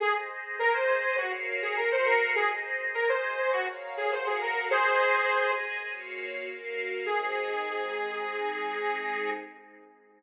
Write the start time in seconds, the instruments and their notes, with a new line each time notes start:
0.00 string ensemble 1 G#4 C5 D#5, lead 2 (sawtooth) G#4
0.59 string ensemble 1 G#4 D#5 G#5, lead 2 (sawtooth) A#4
0.74 lead 2 (sawtooth) C5
1.17 lead 2 (sawtooth) F#4, string ensemble 1 F#4 A#4 C#5 F5
1.62 lead 2 (sawtooth) G#4
1.77 string ensemble 1 F#4 A#4 F5 F#5, lead 2 (sawtooth) A#4
1.92 lead 2 (sawtooth) C5
2.05 lead 2 (sawtooth) A#4
2.35 string ensemble 1 G#4 C5 D#5, lead 2 (sawtooth) G#4
2.94 string ensemble 1 G#4 D#5 G#5, lead 2 (sawtooth) A#4
3.09 lead 2 (sawtooth) C5
3.52 lead 2 (sawtooth) F#4, string ensemble 1 F#4 A#4 C#5 F5
3.97 lead 2 (sawtooth) G#4
4.12 string ensemble 1 F#4 A#4 F5 F#5, lead 2 (sawtooth) C5
4.26 lead 2 (sawtooth) G#4
4.41 lead 2 (sawtooth) A#4
4.70 string ensemble 1 G#4 C5 D#5, lead 2 (sawtooth) G#4 C5
5.30 string ensemble 1 G#4 D#5 G#5
5.88 string ensemble 1 A#3 F#4 C#5 F5
6.47 string ensemble 1 A#3 F#4 A#4 F5
7.06 string ensemble 1 G#3 C4 D#4, lead 2 (sawtooth) G#4